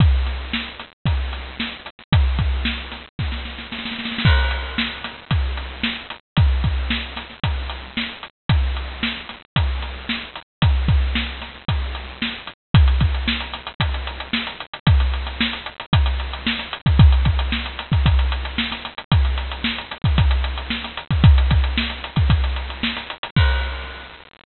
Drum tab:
CC |--------------------------------|--------------------------------|x-------------------------------|--------------------------------|
HH |x---x-------x---x---x-------x---|x---x-------x-------------------|----x-------x---x---x-------x---|x---x-------x---x---x-------x---|
SD |----o---o---o-------o---o-----o-|--o-----o---o---o-o-o-o-oooooooo|--o-----o-o-o-o---------o---o---|--------o---o-o---------o-------|
BD |o---------------o---------------|o---o-----------o---------------|o---------------o---------------|o---o-----------o---------------|

CC |--------------------------------|--------------------------------|--------------------------------|--------------------------------|
HH |x---x-------x---x---x-------x---|x---x-------x---x---x-------x---|x-x-x-x---x-x-x-x-x-x-x---x-x-x-|x-x-x-x---x-x-x-x-x-x-x---x-x-x-|
SD |--------o---o-------o---o-------|------o-o---o-o---------o-------|--------o---o-----------o-o-----|--o---o-o-o-------o-----o-o-----|
BD |o---------------o---------------|o---o-----------o---------------|o---o-----------o---------------|o---------------o-------------o-|

CC |--------------------------------|--------------------------------|--------------------------------|x-------------------------------|
HH |x-x-x-x---x-x-x-x-x-x-x---x-x-x-|x-x-x-x---x-x-x-x-x-x-x---x-x-x-|x-x-x-x---x-x-x-x-x-x-x---x-x-x-|--------------------------------|
SD |--------o-o-o-----------o-o-o---|--------o---o-----------o-o-----|--------o-o-------------o-o-----|--------------------------------|
BD |o---o---------o-o---------------|o-------------o-o-------------o-|o---o---------o-o---------------|o-------------------------------|